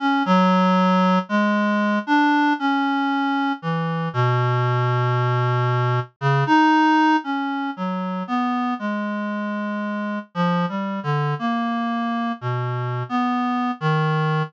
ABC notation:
X:1
M:2/4
L:1/16
Q:1/4=58
K:none
V:1 name="Clarinet"
^C ^F,4 ^G,3 | D2 ^C4 E,2 | B,,8 | ^C, ^D3 ^C2 ^F,2 |
B,2 ^G,6 | (3F,2 G,2 D,2 ^A,4 | (3B,,4 B,4 ^D,4 |]